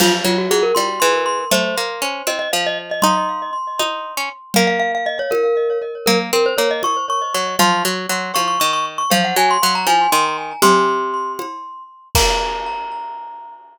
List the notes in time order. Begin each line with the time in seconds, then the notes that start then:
0.00 F3 F4, crash, cowbell, low conga
0.24 F#3 F4
0.38 F#4
0.51 F#3 G#4
0.63 A#4
0.75 G3 C6, cowbell, high conga
1.00 E3 C6
1.26 C6
1.51 A3 C5, cowbell, low conga
1.78 A#3
2.02 C#4
2.27 C4 D#5, cowbell, high conga
2.39 D#5
2.53 F3 F5
2.66 D#5
2.91 D#5
3.02 D#4 C6, cowbell, low conga
3.79 D#4, cowbell, high conga
4.17 C#4
4.54 A#3 F5, cowbell, low conga
4.67 F5
4.80 F5
4.95 F5
5.06 D#5
5.19 C#5
5.31 A#4, cowbell, high conga
6.06 A#3 A#4, cowbell, low conga
6.33 C4 A#4
6.46 C5
6.58 A#3 C#5
6.71 D#5
6.83 C#6, cowbell, high conga
7.10 C#6
7.34 F#3 C#6
7.59 F3 C6, cowbell, low conga
7.85 F#3
8.09 F#3
8.34 F3 C#6, cowbell, high conga
8.48 C#6
8.60 D#3 C#6
8.73 C#6
8.98 C#6
9.10 F3 F5, cowbell, low conga
9.24 F#5
9.36 F#3 G#5
9.51 C6
9.63 F#3 C6
9.75 A#5
9.87 F3 G#5, cowbell, high conga
10.12 D#3 C6
10.62 C3 C6, cowbell, low conga
11.39 cowbell, high conga
12.15 A#3 A#5, kick, crash